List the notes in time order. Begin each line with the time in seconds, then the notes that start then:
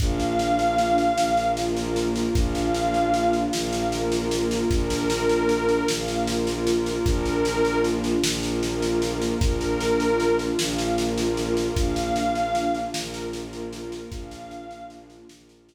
0.00 A#1 A#3 D4 F4 F5, kick, snare
0.20 snare
0.39 snare
0.59 snare
0.78 snare
0.98 snare
1.17 A#1 A#3 F4 A#4, snare
1.37 snare
1.57 snare
1.77 snare
1.96 snare
2.16 snare
2.35 A#1 A#3 D4 F4 F5, kick, snare
2.55 snare
2.75 snare
2.94 snare
3.14 snare
3.33 snare
3.52 A#1 A#3 F4 A#4 F5, snare
3.73 snare
3.92 snare
4.12 snare
4.31 snare
4.51 snare
4.70 A#1 A#3 D4 F4 A#4, kick, snare
4.90 snare
5.10 snare
5.29 snare
5.49 snare
5.69 snare
5.88 A#1 A#3 F4 A#4 F5, snare
6.08 snare
6.27 snare
6.47 snare
6.67 snare
6.86 snare
7.04 A#1 A#3 D4 F4 A#4, kick, snare
7.25 snare
7.45 snare
7.65 snare
7.84 snare
8.04 snare
8.23 A#1 A#3 F4 A#4, snare
8.43 snare
8.63 snare
8.82 snare
9.02 snare
9.22 snare
9.40 A#1 A#3 D4 F4 A#4, kick, snare
9.61 snare
9.81 snare
10.00 snare
10.20 snare
10.39 snare
10.59 A#1 A#3 F4 A#4 F5, snare
10.78 snare
10.98 snare
11.18 snare
11.37 snare
11.57 snare
11.75 A#1 A#3 D4 F4 F5, kick, snare
11.96 snare
12.16 snare
12.35 snare
12.55 snare
12.75 snare
12.94 A#1 A#3 F4 A#4, snare
13.14 snare
13.33 snare
13.53 snare
13.73 snare
13.92 snare
14.10 A#1 A#3 D4 F4 F5, kick, snare
14.31 snare
14.51 snare
14.71 snare
14.90 snare
15.10 snare
15.29 A#1 A#3 F4 A#4, snare
15.49 snare
15.69 snare